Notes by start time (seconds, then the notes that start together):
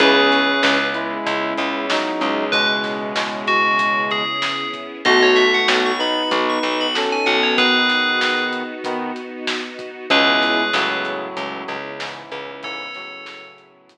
0.00 C#2 E3 B3 C#4 E4 G#4 B4, kick, closed hi-hat
0.32 snare, closed hi-hat
0.63 C#2 C#3, snare
0.94 G#3 E4, closed hi-hat
1.26 C#2 C#3, kick, closed hi-hat
1.58 C#2 C#3, closed hi-hat
1.90 F#3 D#4, snare
2.20 C#2 C#3, closed hi-hat
2.52 B2 G#3 B4, kick, closed hi-hat
2.84 snare, closed hi-hat
3.15 B2 G#3, snare
3.47 F#4, closed hi-hat
3.79 kick, closed hi-hat
4.11 G#4, closed hi-hat
4.42 snare
4.73 kick, closed hi-hat
5.05 B1 A3 B3 D#4 F#4 D#5, kick, closed hi-hat
5.23 C#5
5.36 E5, snare, closed hi-hat
5.54 F#5
5.68 B1 B3, snare
5.86 C#6
5.99 D#4 B4 B5, closed hi-hat
6.31 B1 B3, kick, closed hi-hat
6.50 C#6
6.63 B1 B3, closed hi-hat
6.81 B5
6.95 C#4 A4, snare
7.12 G#5
7.26 B1 B3 F#5, closed hi-hat
7.43 C#5
7.57 D#3 B3 G#4 B4, kick, closed hi-hat
7.89 snare, closed hi-hat
8.21 snare
8.53 closed hi-hat
8.84 D#3 B3, kick, closed hi-hat
9.16 closed hi-hat
9.47 snare
9.79 kick, closed hi-hat
10.10 C#2 B2 G#3 B3 C#4 E4 G#4 B4, kick, closed hi-hat
10.42 snare, closed hi-hat
10.73 C#2 A2 C#3 F#3, snare
11.05 closed hi-hat
11.37 C#2 C#3, kick, closed hi-hat
11.68 C#2 C#3, closed hi-hat
12.00 G#2 E3, snare
12.32 C#2 C#3, closed hi-hat
12.62 G#2 E3 A4 C#5, kick, closed hi-hat
12.94 A2 F#3, snare, closed hi-hat
13.26 snare
13.58 closed hi-hat
13.89 kick, closed hi-hat